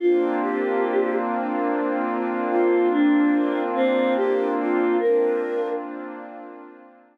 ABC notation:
X:1
M:3/4
L:1/8
Q:1/4=72
K:Bbmix
V:1 name="Choir Aahs"
F G2 z3 | F D2 C G F | B2 z4 |]
V:2 name="Pad 5 (bowed)"
[B,CDF]6- | [B,CDF]6 | [B,CDF]6 |]